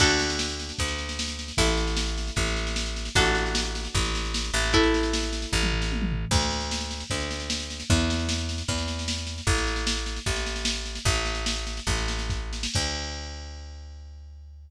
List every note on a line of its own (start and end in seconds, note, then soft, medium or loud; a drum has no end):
0.00 0.72 D2 medium
0.00 1.42 D4 medium
0.00 1.42 F#4 loud
0.00 1.42 A4 loud
0.00 kick loud
0.00 snare loud
0.00 crash loud
0.10 snare medium
0.19 snare medium
0.30 snare medium
0.39 snare loud
0.49 snare medium
0.59 snare medium
0.69 snare medium
0.78 1.52 D2 medium
0.78 kick medium
0.78 snare medium
0.88 snare medium
0.98 snare medium
1.09 snare medium
1.19 snare loud
1.28 snare medium
1.39 snare medium
1.48 snare medium
1.57 2.31 A1 loud
1.57 3.00 E4 medium
1.57 3.00 A4 loud
1.57 kick loud
1.57 snare loud
1.67 snare medium
1.77 snare medium
1.87 snare medium
1.97 snare loud
2.07 snare medium
2.18 snare medium
2.27 snare medium
2.36 3.09 A1 medium
2.36 kick loud
2.36 snare medium
2.47 snare medium
2.56 snare medium
2.67 snare medium
2.76 snare loud
2.86 snare medium
2.96 snare medium
3.05 snare medium
3.15 3.88 A1 medium
3.15 4.58 D4 loud
3.15 4.58 F#4 loud
3.15 4.58 A4 loud
3.15 kick loud
3.15 snare medium
3.25 snare medium
3.35 snare medium
3.46 snare medium
3.55 snare loud
3.65 snare medium
3.75 snare medium
3.85 snare medium
3.94 4.51 A1 medium
3.94 kick loud
3.94 snare medium
4.05 snare medium
4.15 snare loud
4.25 snare medium
4.34 snare loud
4.44 snare medium
4.54 5.46 A1 loud
4.54 snare medium
4.63 snare medium
4.73 6.16 E4 loud
4.73 6.16 A4 loud
4.73 kick loud
4.73 snare medium
4.83 snare medium
4.94 snare medium
5.03 snare medium
5.13 snare loud
5.23 snare medium
5.33 snare medium
5.42 snare medium
5.52 6.25 A1 loud
5.52 kick medium
5.63 mid tom medium
5.72 floor tom medium
5.82 snare medium
5.92 high tom medium
6.02 mid tom loud
6.12 floor tom loud
6.31 7.04 D2 loud
6.31 kick loud
6.31 snare medium
6.31 crash loud
6.42 snare medium
6.51 snare medium
6.60 snare medium
6.71 snare loud
6.81 snare medium
6.91 snare medium
7.00 snare medium
7.10 7.83 D2 medium
7.10 kick medium
7.10 snare medium
7.20 snare medium
7.31 snare medium
7.40 snare medium
7.50 snare loud
7.60 snare medium
7.70 snare medium
7.80 snare medium
7.90 8.63 E2 loud
7.90 kick loud
7.90 snare medium
7.99 snare medium
8.10 snare loud
8.19 snare medium
8.29 snare loud
8.38 snare medium
8.49 snare medium
8.58 snare medium
8.68 9.41 E2 medium
8.68 kick loud
8.68 snare medium
8.78 snare medium
8.88 snare medium
8.99 snare medium
9.08 snare loud
9.18 snare medium
9.27 snare medium
9.38 snare medium
9.47 10.19 A1 loud
9.47 kick loud
9.47 snare medium
9.58 snare medium
9.67 snare medium
9.76 snare medium
9.87 snare loud
9.97 snare medium
10.06 snare medium
10.16 snare medium
10.26 10.99 A1 medium
10.26 kick loud
10.26 snare medium
10.36 snare medium
10.46 snare medium
10.56 snare medium
10.65 snare loud
10.75 snare medium
10.85 snare medium
10.95 snare medium
11.05 11.80 A1 loud
11.05 kick loud
11.05 snare medium
11.15 snare medium
11.25 snare medium
11.35 snare medium
11.46 snare loud
11.56 snare medium
11.67 snare medium
11.77 snare medium
11.87 12.67 A1 medium
11.87 kick loud
11.87 snare medium
11.98 snare medium
12.08 snare loud
12.19 snare medium
12.30 kick loud
12.30 snare medium
12.53 snare medium
12.63 snare loud
12.74 14.70 D2 medium
12.74 kick loud
12.74 crash loud